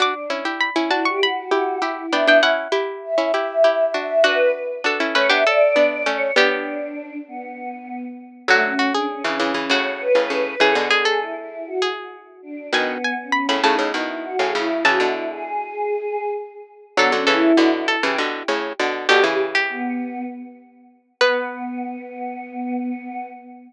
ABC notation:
X:1
M:7/8
L:1/16
Q:1/4=99
K:Bm
V:1 name="Pizzicato Strings"
d'2 z2 b2 a c' b6 | g g f6 z6 | F2 z2 A2 B G A6 | G6 z8 |
[K:F#m] F2 F G5 F4 z2 | G2 G A5 G4 z2 | g2 g2 b b a2 z6 | a8 z6 |
[K:Bm] A2 A4 A2 z6 | G z2 G5 z6 | B14 |]
V:2 name="Choir Aahs"
D2 z4 E G F4 E2 | e2 z4 e e e4 e2 | B2 z4 c e d4 c2 | D6 B,6 z2 |
[K:F#m] A, C2 D C C2 C c2 B2 B2 | A z G2 E E2 F z4 D2 | B,3 C3 ^D2 E2 F G E2 | F E2 G7 z4 |
[K:Bm] B, C E3 E z G z6 | G G z2 B,4 z6 | B,14 |]
V:3 name="Harpsichord"
[DF] z [CE] [EG]2 [CE] [DF]4 [EG]2 [EG]2 | [B,D] [B,D] [CE]2 [EG]3 [CE] [EG]2 [EG]2 [DF]2 | [DF]4 [DF] [CE] [A,C] [B,D] z2 [B,D]2 [A,C]2 | [G,B,]8 z6 |
[K:F#m] [D,F,]2 z3 [C,E,] [C,E,] [C,E,] [A,,C,]3 [A,,C,] [A,,C,]2 | [C,E,] [B,,D,]9 z4 | [B,,^D,]2 z3 [A,,C,] [A,,C,] [A,,C,] [B,,D,]3 [A,,C,] [A,,C,]2 | [C,E,] [B,,D,]9 z4 |
[K:Bm] [D,F,] [D,F,] [C,E,]2 [B,,D,]3 [C,E,] [B,,D,]2 [A,,C,]2 [B,,D,]2 | [B,,D,] [C,E,]13 | B,14 |]